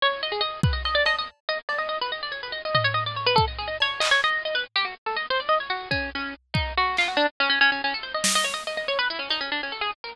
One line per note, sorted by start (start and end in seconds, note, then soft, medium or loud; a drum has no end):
0.02 0.21 C#5 loud
0.23 0.32 D#5 medium
0.32 0.41 G#4 medium
0.41 0.60 D#5 medium
0.63 0.73 B4 medium
0.63 kick loud
0.73 0.82 D#5 soft
0.85 0.95 D#5 medium
0.85 cowbell medium
0.95 1.04 D5 medium
1.06 1.16 D#5 loud
1.06 cowbell medium
1.18 1.28 D#5 medium
1.49 1.58 D#5 loud
1.69 1.78 D5 medium
1.69 cowbell medium
1.78 1.88 D#5 medium
1.89 1.98 D#5 medium
2.01 2.11 B4 medium
2.12 2.21 D#5 medium
2.23 2.32 D5 medium
2.32 2.41 C#5 medium
2.43 2.52 B4 medium
2.52 2.62 D#5 medium
2.65 2.74 D#5 medium
2.75 2.84 D#5 medium
2.75 floor tom medium
2.84 2.94 C#5 loud
2.94 3.04 D#5 medium
3.06 3.16 D5 medium
3.16 3.26 C#5 medium
3.26 3.36 B4 loud
3.36 3.45 A4 loud
3.36 kick medium
3.48 3.57 D#5 medium
3.58 3.68 G#4 medium
3.68 3.77 D#5 medium
3.80 4.01 C#5 loud
3.80 cowbell medium
4.00 4.10 D#5 loud
4.00 clap loud
4.11 4.21 C#5 loud
4.24 4.43 D#5 loud
4.45 4.55 D#5 medium
4.55 4.64 B4 medium
4.76 4.85 G4 loud
4.85 4.94 F#4 medium
5.06 5.16 A4 medium
5.16 5.26 D#5 medium
5.30 5.40 C5 loud
5.40 5.49 D5 medium
5.49 5.58 D#5 loud
5.60 5.70 C#5 medium
5.70 5.89 F#4 medium
5.91 6.10 C#4 medium
5.91 kick medium
6.15 6.34 C#4 medium
6.54 6.73 D#4 medium
6.54 kick medium
6.77 6.96 F#4 loud
6.97 7.08 F4 medium
6.97 clap medium
7.08 7.17 F#4 medium
7.17 7.26 D4 loud
7.40 7.49 C#4 loud
7.50 7.59 C#4 medium
7.61 7.70 C#4 loud
7.72 7.81 C#4 medium
7.84 7.93 C#4 medium
7.94 8.04 A4 medium
8.03 8.13 C5 medium
8.14 8.24 D#5 medium
8.24 8.34 D#5 medium
8.24 snare loud
8.35 8.45 D#5 loud
8.44 8.54 C#5 medium
8.54 8.63 D#5 medium
8.67 8.76 D#5 medium
8.77 8.87 D#5 medium
8.88 8.98 C#5 loud
8.99 9.08 B4 loud
9.10 9.19 E4 medium
9.19 9.29 C#4 medium
9.30 9.40 D#4 medium
9.30 cowbell medium
9.41 9.50 C#4 medium
9.52 9.61 D4 medium
9.63 9.73 C#4 medium
9.72 9.82 A4 medium
9.81 9.91 G#4 medium
10.04 10.13 A#4 medium